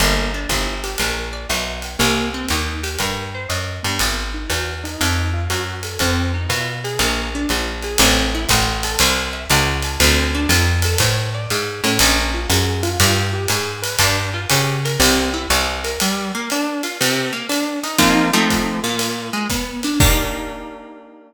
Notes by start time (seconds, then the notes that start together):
0.00 G1 A#3, ride
0.34 D4
0.49 G1 E4, kick, hi-hat pedal, ride
0.84 G4, ride
0.98 A#1 A#4, ride
1.33 D5
1.49 B1 E5, hi-hat pedal, ride
1.82 G5, ride
1.99 C2 A#3, ride
2.34 C4
2.48 D#2 D#4, hi-hat pedal, ride
2.83 G4, ride
2.99 G2 A#4, kick, ride
3.34 C5
3.49 F#2 D#5, hi-hat pedal, ride
3.83 G2 B3, ride
3.99 G#1, ride
4.34 D#4
4.50 E2 F#4, hi-hat pedal, ride
4.84 D#4, ride
5.01 F2, ride
5.33 F4
5.50 F#2 F#4, hi-hat pedal, ride
5.83 A4, ride
5.99 F2 C4, kick, ride
6.34 D#4
6.49 B2 F4, hi-hat pedal, ride
6.84 G#4, ride
6.99 A#1 A#3, ride
7.35 D4
7.49 A#1 F4, hi-hat pedal, ride
7.83 G#4, ride
7.98 A1 C4, ride
8.34 E4
8.49 A1 F#4, kick, hi-hat pedal, ride
8.83 A4, ride
8.99 C2 C5, ride
9.33 E5
9.50 C#2 F#5, hi-hat pedal, ride
9.82 A5, ride
10.00 D2 C4, ride
10.34 D4
10.49 F2 F4, hi-hat pedal, ride
10.82 A4, ride
10.98 A2 C5, kick, ride
11.34 D5
11.50 G#2 F5, hi-hat pedal, ride
11.84 A2 C#4, ride
11.99 A#1, ride
12.34 F4
12.49 F#2 G#4, hi-hat pedal, ride
12.83 F4, ride
13.00 G2, ride
13.33 G4
13.48 G#2 G#4, hi-hat pedal, ride
13.82 B4, ride
13.99 G2 D4, kick, ride
14.34 F4
14.49 C#3 G4, hi-hat pedal, ride
14.85 A#4, ride
14.99 C2 C4, ride
15.34 E4
15.50 C2 G4, hi-hat pedal, ride
15.84 A#4, ride
16.00 G3, ride
16.34 A#3
16.50 D4, hi-hat pedal, ride
16.83 F4, ride
17.01 C3, ride
17.32 A#3
17.49 D4, hi-hat pedal, ride
17.83 D#4, ride
17.98 F3 A#3 C4 D#4, kick, ride
18.33 F3 A3 C4 D#4
18.50 kick, hi-hat pedal, ride
18.83 A#2, ride
18.99 ride
19.33 G#3
19.50 B3, kick, hi-hat pedal, ride
19.83 D4, ride
20.00 A#3 D4 D#4 G4, kick, crash